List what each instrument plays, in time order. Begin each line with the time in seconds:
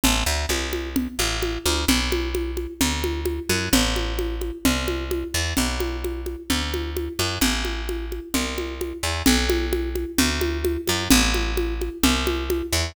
0.04 electric bass (finger) A1, low conga
0.26 electric bass (finger) D2
0.49 electric bass (finger) C2, high conga
0.73 high conga
0.96 low conga
1.19 electric bass (finger) A1, high conga
1.42 high conga
1.65 electric bass (finger) D2, high conga
1.88 electric bass (finger) B1, low conga
2.12 high conga
2.35 high conga
2.57 high conga
2.81 electric bass (finger) D2, low conga
3.04 high conga
3.25 high conga
3.49 electric bass (finger) F#2, high conga
3.73 electric bass (finger) A1, low conga
3.96 high conga
4.19 high conga
4.41 high conga
4.65 electric bass (finger) C2, low conga
4.88 high conga
5.11 high conga
5.34 electric bass (finger) E2
5.57 electric bass (finger) B1, low conga
5.80 high conga
6.04 high conga
6.26 high conga
6.50 electric bass (finger) D2, low conga
6.74 high conga
6.97 high conga
7.19 electric bass (finger) F#2, high conga
7.41 electric bass (finger) A1, low conga
7.65 high conga
7.89 high conga
8.12 high conga
8.34 electric bass (finger) C2, low conga
8.58 high conga
8.81 high conga
9.03 electric bass (finger) E2
9.26 electric bass (finger) B1, low conga
9.50 high conga
9.73 high conga
9.95 high conga
10.18 electric bass (finger) D2, low conga
10.41 high conga
10.65 high conga
10.87 electric bass (finger) F#2, high conga
11.10 electric bass (finger) A1, low conga
11.34 high conga
11.57 high conga
11.81 high conga
12.03 electric bass (finger) C2, low conga
12.27 high conga
12.50 high conga
12.72 electric bass (finger) E2